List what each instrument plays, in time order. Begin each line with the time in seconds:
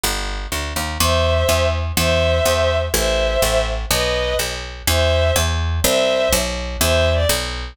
0.03 electric bass (finger) G1
0.52 electric bass (finger) D2
0.76 electric bass (finger) D#2
1.00 electric bass (finger) E2, violin C5 E5
1.49 electric bass (finger) E2
1.97 electric bass (finger) E2, violin C5 E5
2.45 electric bass (finger) E2
2.94 electric bass (finger) A1, violin C5 E5
3.42 electric bass (finger) A1
3.90 electric bass (finger) B1, violin B4 D#5
4.39 electric bass (finger) B1
4.87 electric bass (finger) E2, violin C5 E5
5.36 electric bass (finger) E2
5.84 electric bass (finger) C2, violin C5 E5
6.33 electric bass (finger) B1
6.80 electric bass (finger) E2, violin C5 E5
7.13 violin D5
7.29 electric bass (finger) B1